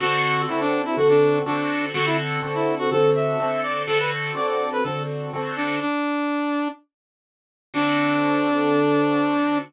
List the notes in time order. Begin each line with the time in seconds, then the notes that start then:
0.00 D3 C4 F#4 A4
0.48 D3 C4 E4 F#4 A4
0.60 D4
0.85 E4
0.97 D3 C4 F#4 A4
1.09 D4
1.46 D3 C4 D4 F#4 A4
1.94 D3 C4 F#4 A4
2.06 E4
2.42 D3 C4 F#4 A4
2.54 E4
2.79 F#4
2.91 D3 C4 F#4 A4
3.15 E5
3.40 D3 C4 F#4 A4
3.63 D5
3.87 D3 C4 F#4 A4
3.99 B4
4.35 D3 C4 F#4 A4 D5
4.48 D5
4.72 B4
4.83 D3 C4 F#4 A4
5.33 D3 C4 F#4 A4
5.56 D4
5.80 D4
7.74 D3 C4 D4 F#4 A4